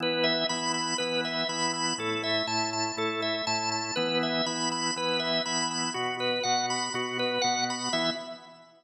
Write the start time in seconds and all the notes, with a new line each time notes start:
0.00 E3 B3 E4 B4
0.23 E5
0.49 E3 B3 E4 B5
0.74 B5
0.98 E3 B3 E4 B4
1.24 E5
1.49 E3 B3 E4 B5
1.73 B5
1.98 A2 A3 E4 A4
2.23 E5
2.47 A2 A3 E4 A5
2.73 A5
2.97 A2 A3 E4 A4
3.22 E5
3.47 A2 A3 E4 A5
3.71 A5
3.96 E3 B3 E4 B4
4.23 E5
4.46 E3 B3 E4 B5
4.71 B5
4.96 E3 B3 E4 B4
5.19 E5
5.45 E3 B3 E4 B5
5.71 B5
5.94 B2 B3 F#4
6.20 B4
6.43 B2 B3 F#4 F#5
6.70 B5
6.94 B2 B3 F#4
7.19 B4
7.41 B2 B3 F#4 F#5
7.70 B5
7.93 E3 B3 E4 E5